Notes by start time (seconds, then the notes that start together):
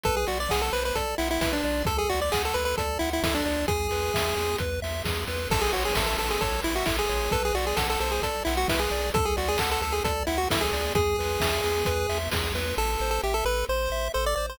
0.04 B1 A4 B4, kick, closed hi-hat
0.17 G#4
0.27 B1 F#4 D5, open hi-hat
0.40 D5
0.49 B1 G#4 F#5, kick, snare
0.62 A4
0.73 B1 B4 C5, open hi-hat
0.85 B4
0.95 B1 A4 D5, kick, closed hi-hat
1.18 B1 E4 F#5, open hi-hat
1.31 E4
1.41 B1 E4 B4, kick, snare
1.53 D4
1.64 B1 D5, open hi-hat
1.85 D2 A4, kick, closed hi-hat
1.98 G#4
2.09 D2 F#4 D5, open hi-hat
2.21 D5
2.32 D2 G#4 F#5, kick, clap
2.45 A4
2.54 D2 A4 B4, open hi-hat
2.65 B4
2.77 D2 A4 D5, kick, closed hi-hat
2.99 D2 E4 F#5, open hi-hat
3.13 E4
3.23 D2 E4 A4, kick, snare
3.35 D4
3.45 D2 D5, open hi-hat
3.68 E2 G#4, kick, closed hi-hat
3.91 E2 B4, open hi-hat
4.14 E2 E5, kick, snare
4.36 E2 G#4, open hi-hat
4.58 E2 B4, kick, closed hi-hat
4.82 E2 E5, open hi-hat
5.04 E2 G#4, kick, snare
5.27 E2 B4, open hi-hat
5.50 A1 A4, kick, crash
5.61 G#4
5.73 A1 F#4 C#5, open hi-hat
5.85 G#4
5.95 A1 A4 E5, kick, snare
6.06 A4
6.18 A1 A4, open hi-hat
6.30 G#4
6.41 A1 A4 C#5, kick, closed hi-hat
6.63 A1 E4 E5, open hi-hat
6.76 F#4
6.86 A1 E4 A4, kick, clap
6.99 G#4
7.09 A1 C#5, open hi-hat
7.31 B1 A4 B4, kick, closed hi-hat
7.45 G#4
7.54 B1 F#4 D5, open hi-hat
7.67 G#4
7.76 B1 A4 F#5, kick, snare
7.90 A4
8.00 B1 A4 C5, open hi-hat
8.11 G#4
8.22 B1 A4 D5, kick, closed hi-hat
8.45 B1 E4 F#5, open hi-hat
8.57 F#4
8.68 B1 E4 B4, kick, snare
8.79 G#4
8.90 B1 D5, open hi-hat
9.14 D2 A4, kick, closed hi-hat
9.25 G#4
9.37 D2 F#4 D5, open hi-hat
9.48 G#4
9.58 D2 A4 F#5, kick, clap
9.71 A4
9.82 D2 A4, open hi-hat
9.92 G#4
10.04 D2 A4 D5, kick, closed hi-hat
10.27 D2 E4 F#5, open hi-hat
10.38 F#4
10.50 D2 E4 A4, kick, snare
10.61 G#4
10.72 D2 D5, open hi-hat
10.95 E2 G#4, kick, closed hi-hat
11.18 E2 B4, open hi-hat
11.40 E2 E5, kick, snare
11.64 E2 G#4, open hi-hat
11.85 E2 B4, kick, closed hi-hat
12.09 E2 E5, open hi-hat
12.31 E2 G#4, kick, snare
12.54 E2 B4, open hi-hat
12.77 A1 A4
13.00 A1 C5
13.11 A4
13.23 A1 G4 E5
13.34 A4
13.45 A1 A4 B4
13.69 A1 C5
13.90 A1 E5
14.14 A1 A4 C5
14.26 D5
14.36 A1 C5 D5
14.50 C5